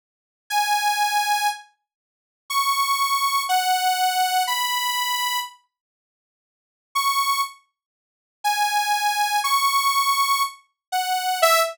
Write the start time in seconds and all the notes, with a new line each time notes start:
0.50 G#5
2.50 C#6
3.49 F#5
4.47 B5
6.95 C#6
8.44 G#5
9.44 C#6
10.92 F#5
11.42 E5